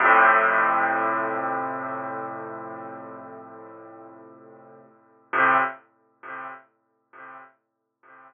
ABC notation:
X:1
M:4/4
L:1/8
Q:1/4=90
K:F
V:1 name="Acoustic Grand Piano" clef=bass
[F,,A,,C,]8- | [F,,A,,C,]8 | [F,,A,,C,]2 z6 |]